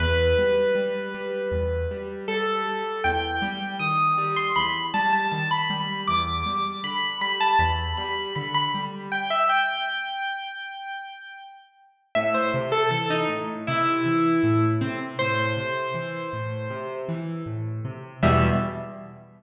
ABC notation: X:1
M:4/4
L:1/16
Q:1/4=79
K:Em
V:1 name="Acoustic Grand Piano"
B12 A4 | g4 ^d'3 c' b2 a a a b3 | d'4 b2 b a b2 b2 b b z2 | g e g12 z2 |
e c z A A ^D z2 E6 C z | c10 z6 | e4 z12 |]
V:2 name="Acoustic Grand Piano" clef=bass
E,,2 G,2 G,2 G,2 E,,2 G,2 G,2 G,2 | E,,2 G,2 ^D,2 G,2 E,,2 G,2 D,2 G,2 | E,,2 G,2 D,2 G,2 E,,2 G,2 D,2 G,2 | z16 |
A,,2 C,2 E,2 A,,2 C,2 E,2 A,,2 C,2 | A,,2 C,2 E,2 A,,2 C,2 E,2 A,,2 C,2 | [E,,B,,G,]4 z12 |]